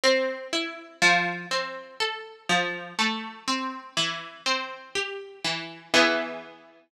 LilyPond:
\new Staff { \time 3/4 \key a \minor \partial 4 \tempo 4 = 61 c'8 e'8 | f8 c'8 a'8 f8 a8 c'8 | e8 c'8 g'8 e8 <e b gis'>4 | }